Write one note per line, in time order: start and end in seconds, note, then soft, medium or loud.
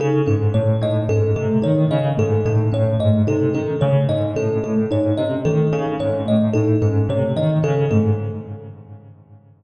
0.00 0.22 C#3 medium
0.00 0.22 D#4 medium
0.00 0.23 A4 medium
0.26 0.49 G#2 medium
0.26 0.48 C#4 medium
0.26 0.49 A4 medium
0.54 0.76 A2 medium
0.54 0.76 A3 medium
0.54 0.76 C#5 medium
0.82 1.04 A2 medium
0.82 1.03 D#4 medium
0.82 1.05 D#5 medium
1.09 1.31 G#2 medium
1.09 1.32 C#4 medium
1.09 1.31 A4 medium
1.36 1.58 C3 medium
1.36 1.58 A3 medium
1.36 1.58 A4 medium
1.62 1.85 D#3 medium
1.62 1.84 D#4 medium
1.62 1.85 C#5 medium
1.91 2.13 C#3 medium
1.91 2.13 C#4 medium
1.91 2.13 D#5 medium
2.17 2.40 G#2 medium
2.17 2.39 A3 medium
2.17 2.41 A4 medium
2.45 2.67 A2 medium
2.45 2.68 D#4 medium
2.45 2.68 A4 medium
2.72 2.95 A2 medium
2.72 2.93 C#4 medium
2.72 2.96 C#5 medium
3.00 3.22 G#2 medium
3.00 3.21 A3 medium
3.00 3.22 D#5 medium
3.27 3.49 C3 medium
3.27 3.49 D#4 medium
3.27 3.50 A4 medium
3.54 3.76 D#3 medium
3.54 3.76 C#4 medium
3.54 3.76 A4 medium
3.81 4.04 C#3 medium
3.81 4.05 A3 medium
3.81 4.03 C#5 medium
4.09 4.31 G#2 medium
4.09 4.31 D#4 medium
4.09 4.31 D#5 medium
4.36 4.58 A2 medium
4.36 4.59 C#4 medium
4.36 4.58 A4 medium
4.63 4.85 A2 medium
4.63 4.85 A3 medium
4.63 4.86 A4 medium
4.91 5.13 G#2 medium
4.91 5.13 D#4 medium
4.91 5.13 C#5 medium
5.18 5.40 C3 medium
5.18 5.40 C#4 medium
5.18 5.39 D#5 medium
5.45 5.67 D#3 medium
5.45 5.67 A3 medium
5.45 5.67 A4 medium
5.73 5.95 C#3 medium
5.73 5.95 D#4 medium
5.73 5.94 A4 medium
5.99 6.22 G#2 medium
5.99 6.21 C#4 medium
5.99 6.22 C#5 medium
6.26 6.49 A2 medium
6.26 6.48 A3 medium
6.26 6.50 D#5 medium
6.53 6.76 A2 medium
6.53 6.77 D#4 medium
6.53 6.75 A4 medium
6.82 7.04 G#2 medium
6.82 7.04 C#4 medium
6.82 7.04 A4 medium
7.09 7.31 C3 medium
7.09 7.32 A3 medium
7.09 7.32 C#5 medium
7.36 7.58 D#3 medium
7.36 7.59 D#4 medium
7.36 7.58 D#5 medium
7.63 7.85 C#3 medium
7.63 7.85 C#4 medium
7.63 7.86 A4 medium
7.91 8.13 G#2 medium
7.91 8.13 A3 medium
7.91 8.13 A4 medium